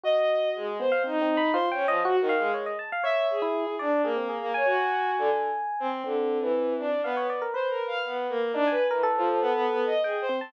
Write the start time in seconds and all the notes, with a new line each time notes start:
0.04 F#4 D#5
0.55 G#3
0.80 B3 C5
0.92 F5
1.04 C4 D#4
1.22 C4
1.37 B5
1.54 F4 C5
1.71 C#4 G5
1.87 F3 D#5
2.05 F#4
2.17 F#4
2.21 D#3
2.29 F5
2.38 G#3
2.54 C#5
2.66 D#5
2.79 A5
2.92 F5
3.04 C#5 E5
3.30 G#4
3.42 E4
3.67 E4
3.79 D4 D5
4.04 A#3 G#4
4.16 C4
4.29 G#4
4.41 A#3
4.54 C#5 G#5
4.65 F#4
5.18 D3
5.80 C4
6.04 D3 C4
6.41 E3
6.79 D4
7.04 B3 F5
7.17 C#5
7.30 D5
7.42 A#4
7.54 B4 C5
7.70 A#4
7.87 F5
8.04 B3
8.29 A#3
8.53 D4 D#4
8.67 B4 G#5
8.89 E3 A#4
9.03 A4
9.18 F3
9.41 B3
9.54 B3
9.69 B3
9.86 D#5
10.03 G#4 G5
10.22 C5
10.29 C4
10.38 C4 A5